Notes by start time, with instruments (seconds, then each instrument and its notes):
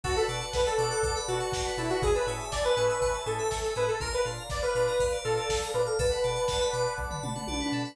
0.04 synth bass 2 B1, drawbar organ D4 F#4 A4 B4, lead 2 (sawtooth) F#4, electric piano 2 A4, pad 2 (warm) B4 D5 F#5 A5, kick, crash
0.16 lead 2 (sawtooth) A4, electric piano 2 B4, ride
0.28 synth bass 2 B2, drawbar organ D4 F#4 A4 B4, electric piano 2 D5, ride
0.41 electric piano 2 F#5, ride
0.53 synth bass 2 B1, lead 2 (sawtooth) B4, electric piano 2 A5, kick, snare
0.66 lead 2 (sawtooth) A4, electric piano 2 B5, ride
0.77 synth bass 2 B2, drawbar organ D4 F#4 A4 B4, electric piano 2 D6, ride
0.90 electric piano 2 F#6, ride
1.03 synth bass 2 B1, electric piano 2 D6, kick, ride
1.15 electric piano 2 B5, ride
1.28 synth bass 2 B2, drawbar organ D4 F#4 A4 B4, lead 2 (sawtooth) F#4, electric piano 2 A5, ride
1.40 electric piano 2 F#5, ride
1.52 synth bass 2 B1, electric piano 2 D5, kick, snare
1.65 electric piano 2 B4, ride
1.77 synth bass 2 B2, drawbar organ D4 F#4 A4 B4, lead 2 (sawtooth) E4, electric piano 2 A4, ride
1.89 lead 2 (sawtooth) F#4, electric piano 2 B4, ride
2.02 synth bass 2 A1, drawbar organ C#4 E4 G#4 A4, electric piano 2 G#4, lead 2 (sawtooth) G#4, pad 2 (warm) C#5 E5 G#5 A5, kick, ride
2.15 electric piano 2 A4, lead 2 (sawtooth) B4, ride
2.27 synth bass 2 A2, drawbar organ C#4 E4 G#4 A4, electric piano 2 C#5, ride
2.40 electric piano 2 E5, ride
2.52 synth bass 2 A1, lead 2 (sawtooth) D5, electric piano 2 G#5, kick, snare
2.64 lead 2 (sawtooth) B4, electric piano 2 A5, ride
2.76 synth bass 2 A2, drawbar organ C#4 E4 G#4 A4, electric piano 2 C#6, ride
2.89 electric piano 2 E6, ride
3.01 synth bass 2 A1, electric piano 2 C#6, kick, ride
3.14 electric piano 2 A5, ride
3.26 synth bass 2 A2, drawbar organ C#4 E4 G#4 A4, lead 2 (sawtooth) A4, electric piano 2 G#5, ride
3.39 electric piano 2 E5, ride
3.51 synth bass 2 A1, electric piano 2 C#5, kick, snare
3.63 electric piano 2 A4, ride
3.76 synth bass 2 A2, drawbar organ C#4 E4 G#4 A4, electric piano 2 G#4, lead 2 (sawtooth) B4, ride
3.88 lead 2 (sawtooth) A4, electric piano 2 A4, ride
4.00 synth bass 2 A#1, drawbar organ D4 F4 A#4, electric piano 2 A#4, lead 2 (sawtooth) A#4, pad 2 (warm) D5 F5 A#5, kick, ride
4.12 lead 2 (sawtooth) B4, electric piano 2 D5, ride
4.25 synth bass 2 A#2, drawbar organ D4 F4 A#4, electric piano 2 F5, ride
4.38 electric piano 2 A#5
4.50 synth bass 2 A#1, lead 2 (sawtooth) D5, electric piano 2 D6, kick, snare
4.62 lead 2 (sawtooth) B4, electric piano 2 F6, ride
4.75 synth bass 2 A#2, drawbar organ D4 F4 A#4, electric piano 2 D6, ride
4.88 electric piano 2 A#5, ride
4.99 synth bass 2 A#1, electric piano 2 F5, kick, ride
5.12 electric piano 2 D5, ride
5.24 synth bass 2 A#2, drawbar organ D4 F4 A#4, lead 2 (sawtooth) A4, electric piano 2 A#4, ride
5.37 electric piano 2 D5, ride
5.49 synth bass 2 A#1, electric piano 2 F5, kick, snare
5.61 electric piano 2 A#5, ride
5.74 synth bass 2 A#2, drawbar organ D4 F4 A#4, lead 2 (sawtooth) B4, electric piano 2 D6, ride
5.86 lead 2 (sawtooth) A4, electric piano 2 F6, ride
5.98 synth bass 2 B1, electric piano 2 A4, lead 2 (sawtooth) B4, pad 2 (warm) D5 F#5 A5 B5, kick, ride
6.11 electric piano 2 B4, ride
6.24 synth bass 2 B2, electric piano 2 D5, ride
6.36 electric piano 2 F#5, ride
6.48 synth bass 2 B1, electric piano 2 A5, kick, snare
6.61 electric piano 2 B5, ride
6.73 synth bass 2 B2, electric piano 2 D6, ride
6.86 electric piano 2 F#6, ride
6.98 synth bass 2 B1, electric piano 2 D6, kick
7.11 electric piano 2 B5, floor tom
7.23 synth bass 2 B2, electric piano 2 A5, mid tom
7.36 electric piano 2 F#5, mid tom
7.47 synth bass 2 B1, electric piano 2 D5, high tom
7.60 electric piano 2 B4, high tom
7.72 synth bass 2 B2, electric piano 2 A4
7.85 electric piano 2 B4